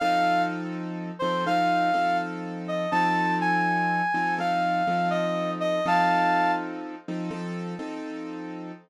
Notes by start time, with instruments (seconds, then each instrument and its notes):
0.00 acoustic grand piano F3 C4 D#4 A4, brass section F5
1.19 acoustic grand piano F3 C4 D#4 A4, brass section C5
1.46 acoustic grand piano F3 C4 D#4 A4, brass section F5
1.94 acoustic grand piano F3 C4 D#4 A4
2.68 brass section D#5
2.91 acoustic grand piano F3 C4 D#4 A4, brass section A5
3.41 brass section G#5
4.14 acoustic grand piano F3 C4 D#4 A4
4.38 acoustic grand piano F3 C4 D#4 A4, brass section F5
4.87 acoustic grand piano F3 C4 D#4 A4
5.10 brass section D#5
5.60 brass section D#5
5.86 acoustic grand piano F3 C4 D#4 A4, brass section F5 A5
7.08 acoustic grand piano F3 C4 D#4 A4
7.31 acoustic grand piano F3 C4 D#4 A4
7.79 acoustic grand piano F3 C4 D#4 A4